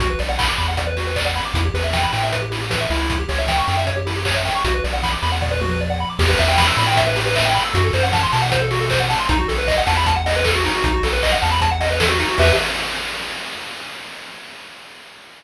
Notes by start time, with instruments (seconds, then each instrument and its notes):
0.00 synth bass 1 B1, lead 1 (square) F#4, kick, closed hi-hat
0.10 lead 1 (square) B4
0.19 synth bass 1 B1, lead 1 (square) D5, open hi-hat
0.29 lead 1 (square) F#5
0.39 lead 1 (square) B5, kick, clap
0.49 lead 1 (square) D6
0.58 synth bass 1 E2, lead 1 (square) B5, open hi-hat
0.68 lead 1 (square) F#5
0.77 lead 1 (square) D5, kick, closed hi-hat
0.87 lead 1 (square) B4
0.97 lead 1 (square) F#4, open hi-hat
1.07 lead 1 (square) B4
1.16 lead 1 (square) D5, kick, clap
1.26 lead 1 (square) F#5
1.36 lead 1 (square) B5, open hi-hat
1.45 lead 1 (square) D6
1.54 synth bass 1 E2, lead 1 (square) E4, kick, closed hi-hat
1.65 lead 1 (square) G4
1.74 synth bass 1 E2, lead 1 (square) B4, open hi-hat
1.84 lead 1 (square) E5
1.93 lead 1 (square) G5, kick, snare
2.03 lead 1 (square) B5
2.13 synth bass 1 A2, lead 1 (square) G5, open hi-hat
2.23 lead 1 (square) E5
2.32 lead 1 (square) B4, kick, closed hi-hat
2.42 lead 1 (square) G4
2.51 lead 1 (square) E4, open hi-hat
2.61 lead 1 (square) G4
2.70 lead 1 (square) B4, kick, snare
2.81 lead 1 (square) E5
2.90 synth bass 1 C#2, lead 1 (square) E4, open hi-hat
3.10 kick, closed hi-hat
3.19 lead 1 (square) G4
3.29 synth bass 1 C#2, lead 1 (square) C#5, open hi-hat
3.38 lead 1 (square) E5
3.48 lead 1 (square) G5, kick, snare
3.58 lead 1 (square) C#6
3.68 synth bass 1 F#2, lead 1 (square) G5, open hi-hat
3.77 lead 1 (square) E5
3.87 lead 1 (square) C#5, kick, closed hi-hat
3.97 lead 1 (square) G4
4.06 lead 1 (square) E4, open hi-hat
4.16 lead 1 (square) G4
4.25 lead 1 (square) C#5, kick, clap
4.36 lead 1 (square) E5
4.45 lead 1 (square) G5, open hi-hat
4.55 lead 1 (square) C#6
4.65 synth bass 1 B1, lead 1 (square) F#4, kick, closed hi-hat
4.74 lead 1 (square) B4
4.84 synth bass 1 B1, lead 1 (square) D5, open hi-hat
4.93 lead 1 (square) F#5
5.03 lead 1 (square) B5, kick, snare
5.13 lead 1 (square) D6
5.23 synth bass 1 E2, lead 1 (square) B5, open hi-hat
5.32 lead 1 (square) F#5
5.42 lead 1 (square) D5, kick, floor tom
5.51 lead 1 (square) B4
5.61 lead 1 (square) F#4, mid tom
5.71 lead 1 (square) B4
5.81 lead 1 (square) D5
5.90 lead 1 (square) F#5
6.00 lead 1 (square) B5
6.10 lead 1 (square) D6
6.19 synth bass 1 E2, lead 1 (square) G4, kick, crash
6.29 lead 1 (square) B4
6.38 synth bass 1 E2, lead 1 (square) E5, open hi-hat
6.48 lead 1 (square) G5
6.58 lead 1 (square) B5, kick, snare
6.67 lead 1 (square) E6
6.77 synth bass 1 A2, lead 1 (square) B5, open hi-hat
6.87 lead 1 (square) G5
6.97 lead 1 (square) E5, kick, closed hi-hat
7.07 lead 1 (square) B4
7.16 lead 1 (square) G4, open hi-hat
7.26 lead 1 (square) B4
7.36 lead 1 (square) E5, kick, clap
7.45 lead 1 (square) G5
7.54 lead 1 (square) B5, open hi-hat
7.65 lead 1 (square) E6
7.74 synth bass 1 F#2, lead 1 (square) F#4, kick, closed hi-hat
7.84 lead 1 (square) A4
7.93 synth bass 1 F#2, lead 1 (square) C5, open hi-hat
8.03 lead 1 (square) F#5
8.13 lead 1 (square) A5, kick, snare
8.23 lead 1 (square) C6
8.32 synth bass 1 B2, lead 1 (square) A5, open hi-hat
8.42 lead 1 (square) F#5
8.51 lead 1 (square) C5, kick, closed hi-hat
8.62 lead 1 (square) A4
8.71 lead 1 (square) F#4, open hi-hat
8.81 lead 1 (square) A4
8.90 lead 1 (square) C5, kick, clap
9.00 lead 1 (square) F#5
9.10 lead 1 (square) A5, open hi-hat
9.19 lead 1 (square) C6
9.29 synth bass 1 B1, lead 1 (square) D#4, kick, closed hi-hat
9.39 lead 1 (square) F#4
9.48 synth bass 1 B1, lead 1 (square) A4, open hi-hat
9.58 lead 1 (square) B4
9.68 lead 1 (square) D#5, kick, clap
9.78 lead 1 (square) F#5
9.87 synth bass 1 E2, lead 1 (square) A5, open hi-hat
9.97 lead 1 (square) B5
10.06 lead 1 (square) A5, kick, closed hi-hat
10.16 lead 1 (square) F#5
10.26 lead 1 (square) D#5, open hi-hat
10.36 lead 1 (square) B4
10.45 lead 1 (square) A4, kick, clap
10.55 lead 1 (square) F#4
10.64 lead 1 (square) D#4, open hi-hat
10.75 lead 1 (square) F#4
10.84 synth bass 1 B1, lead 1 (square) D#4, kick, closed hi-hat
10.94 lead 1 (square) F#4
11.03 synth bass 1 B1, lead 1 (square) A4, open hi-hat
11.13 lead 1 (square) B4
11.22 lead 1 (square) D#5, kick, clap
11.32 lead 1 (square) F#5
11.42 synth bass 1 E2, lead 1 (square) A5, open hi-hat
11.52 lead 1 (square) B5
11.61 lead 1 (square) A5, kick, closed hi-hat
11.71 lead 1 (square) F#5
11.81 lead 1 (square) D#5, open hi-hat
11.90 lead 1 (square) B4
12.00 lead 1 (square) A4, kick, snare
12.09 lead 1 (square) F#4
12.19 lead 1 (square) D#4, open hi-hat
12.29 lead 1 (square) F#4
12.38 synth bass 1 E2, lead 1 (square) G4 B4 E5, kick, crash